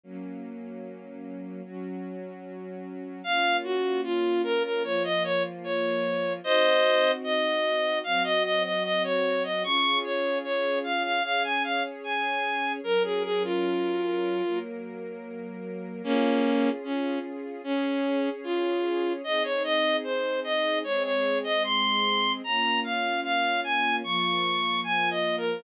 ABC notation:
X:1
M:4/4
L:1/16
Q:1/4=75
K:Bbm
V:1 name="Violin"
z16 | f2 G2 F2 B B d e d z d4 | [ce]4 e4 f e e e e d2 e | d'2 d2 d2 f f f a f z a4 |
B A A F7 z6 | [K:Db] [B,D]4 D2 z2 D4 F4 | e d e2 c2 e2 d d2 e c'4 | b2 f2 f2 a2 d'4 (3a2 e2 B2 |]
V:2 name="String Ensemble 1"
[G,B,D]8 [G,DG]8 | [B,DF]8 [F,B,F]8 | [CEG]8 [G,CG]8 | [DFA]8 [DAd]8 |
[G,DB]8 [G,B,B]8 | [K:Db] [DFA]8 [DAd]8 | [CEA]8 [A,CA]8 | [B,DF]8 [F,B,F]8 |]